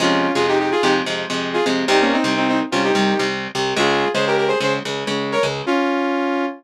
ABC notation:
X:1
M:4/4
L:1/16
Q:1/4=127
K:Fm
V:1 name="Lead 2 (sawtooth)"
[DF]3 [FA] [EG] [EG] [FA] [EG] z5 [FA] z2 | [EG] [B,D] [CE]2 [CE] [CE] z [DF] [EG]4 z4 | [FA]3 [Ac] [GB] [GB] [Ac] [Ac] z5 [Bd] z2 | [DF]8 z8 |]
V:2 name="Overdriven Guitar" clef=bass
[F,,C,A,]3 [F,,C,A,]4 [F,,C,A,]2 [F,,C,A,]2 [F,,C,A,]3 [F,,C,A,]2 | [C,,C,G,]3 [C,,C,G,]4 [C,,C,G,]2 [C,,C,G,]2 [C,,C,G,]3 [C,,C,G,]2 | [D,,D,A,]3 [D,,D,A,]4 [D,,D,A,]2 [D,,D,A,]2 [D,,D,A,]3 [D,,D,A,]2 | z16 |]